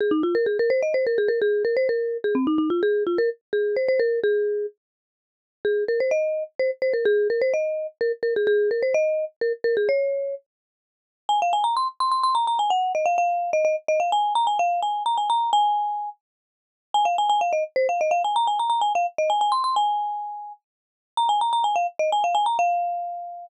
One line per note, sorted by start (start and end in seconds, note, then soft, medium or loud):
0.00 0.12 G#4 medium
0.11 0.22 D#4 medium
0.23 0.34 F4 medium
0.35 0.46 A#4 medium
0.46 0.58 G#4 medium
0.59 0.71 A#4 loud
0.70 0.81 C5 medium
0.83 0.94 D#5 medium
0.94 1.05 C5 medium
1.07 1.18 A#4 medium
1.18 1.29 G#4 medium
1.28 1.40 A#4 medium
1.42 1.63 G#4 loud
1.65 1.76 A#4 medium
1.77 1.88 C5 medium
1.89 2.17 A#4 medium
2.24 2.35 G#4 medium
2.35 2.46 C4 medium
2.47 2.58 D#4 medium
2.58 2.69 D#4 medium
2.70 2.81 F4 medium
2.83 3.04 G#4 loud
3.07 3.18 F4 medium
3.18 3.30 A#4 loud
3.53 3.76 G#4 medium
3.76 3.88 C5 medium
3.88 4.00 C5 loud
4.00 4.20 A#4 medium
4.24 4.66 G#4 loud
5.65 5.84 G#4 medium
5.88 6.00 A#4 medium
6.00 6.11 C5 medium
6.11 6.44 D#5 medium
6.59 6.71 C5 medium
6.82 6.93 C5 medium
6.94 7.05 A#4 medium
7.05 7.28 G#4 loud
7.30 7.41 A#4 medium
7.41 7.53 C5 medium
7.54 7.87 D#5 medium
8.01 8.12 A#4 medium
8.23 8.34 A#4 medium
8.36 8.47 G#4 medium
8.47 8.70 G#4 loud
8.71 8.82 A#4 medium
8.83 8.94 C5 medium
8.94 9.25 D#5 loud
9.41 9.53 A#4 medium
9.64 9.75 A#4 medium
9.77 9.88 G#4 medium
9.89 10.35 C#5 loud
11.29 11.40 G#5 loud
11.42 11.53 F5 medium
11.53 11.64 G#5 medium
11.64 11.75 A#5 medium
11.77 11.88 C6 medium
12.00 12.11 C6 medium
12.12 12.23 C6 medium
12.23 12.35 C6 loud
12.35 12.46 A#5 medium
12.47 12.59 A#5 medium
12.59 12.70 G#5 medium
12.70 12.92 F#5 medium
12.95 13.06 D#5 medium
13.06 13.17 F5 medium
13.18 13.51 F5 medium
13.53 13.64 D#5 loud
13.65 13.76 D#5 medium
13.88 14.00 D#5 loud
14.00 14.11 F5 medium
14.12 14.33 G#5 loud
14.35 14.47 A#5 loud
14.47 14.58 G#5 medium
14.59 14.80 F5 medium
14.82 15.03 G#5 medium
15.06 15.17 A#5 medium
15.18 15.29 G#5 medium
15.30 15.51 A#5 loud
15.53 16.09 G#5 loud
16.94 17.05 G#5 loud
17.05 17.16 F5 medium
17.18 17.29 G#5 medium
17.30 17.41 G#5 loud
17.41 17.52 F5 medium
17.53 17.64 D#5 medium
17.76 17.87 C5 loud
17.89 18.00 F5 medium
18.01 18.12 D#5 medium
18.11 18.22 F5 medium
18.24 18.36 G#5 medium
18.36 18.47 A#5 loud
18.47 18.59 G#5 medium
18.59 18.69 A#5 medium
18.70 18.81 A#5 medium
18.81 18.93 G#5 medium
18.95 19.06 F5 medium
19.18 19.30 D#5 medium
19.30 19.41 G#5 medium
19.41 19.52 G#5 medium
19.52 19.63 C6 medium
19.64 19.75 C6 medium
19.76 20.53 G#5 loud
21.17 21.29 A#5 loud
21.29 21.40 G#5 loud
21.41 21.52 A#5 medium
21.53 21.64 A#5 medium
21.64 21.75 G#5 medium
21.76 21.87 F5 medium
21.99 22.10 D#5 medium
22.12 22.24 G#5 medium
22.24 22.35 F5 medium
22.35 22.46 G#5 loud
22.46 22.57 A#5 medium
22.59 23.46 F5 loud